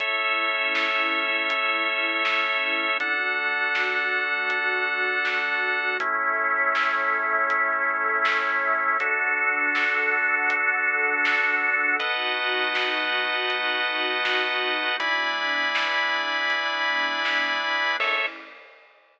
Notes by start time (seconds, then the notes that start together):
0.00 A3 C#4 E4 A4 C#5 E5, kick, closed hi-hat
0.75 snare
1.50 closed hi-hat
2.25 snare
3.00 D3 A3 D4 F#4 A4 F#5, kick, closed hi-hat
3.75 snare
4.50 closed hi-hat
5.25 snare
6.00 A3 C#4 E4 A4 C#5 E5, kick, closed hi-hat
6.75 snare
7.50 closed hi-hat
8.25 snare
8.99 D4 F#4 A4 F#5, kick, closed hi-hat
9.75 snare
10.50 closed hi-hat
11.25 snare
11.99 B2 A3 D#4 F#4 B4 D#5 F#5 A5, kick, closed hi-hat
12.75 snare
13.50 closed hi-hat
14.25 snare
15.00 E3 G#3 B3 D4 E4 D5 G#5 B5, kick, closed hi-hat
15.75 snare
16.50 closed hi-hat
17.25 snare
17.98 A3 C#4 E4 A4 C#5 E5, kick, crash